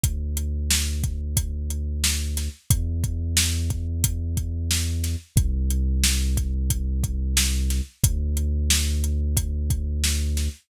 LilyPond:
<<
  \new Staff \with { instrumentName = "Synth Bass 2" } { \clef bass \time 4/4 \key e \minor \tempo 4 = 90 d,1 | e,1 | c,1 | d,1 | }
  \new DrumStaff \with { instrumentName = "Drums" } \drummode { \time 4/4 <hh bd>8 hh8 sn8 <hh bd>8 <hh bd>8 hh8 sn8 <hh sn>8 | <hh bd>8 <hh bd>8 sn8 <hh bd>8 <hh bd>8 <hh bd>8 sn8 <hh sn>8 | <hh bd>8 hh8 sn8 <hh bd>8 <hh bd>8 <hh bd>8 sn8 <hh sn>8 | <hh bd>8 hh8 sn8 hh8 <hh bd>8 <hh bd>8 sn8 <hh sn>8 | }
>>